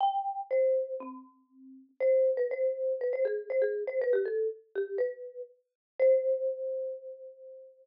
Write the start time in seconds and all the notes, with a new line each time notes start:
0.01 G5
0.51 C5
1.00 C4
2.00 C5
2.37 B4
2.51 C5
3.01 B4
3.13 C5
3.25 G#4
3.50 C5
3.62 G#4
3.87 C5
4.01 B4
4.13 G4
4.26 A4
4.75 G4
4.98 B4
5.99 C5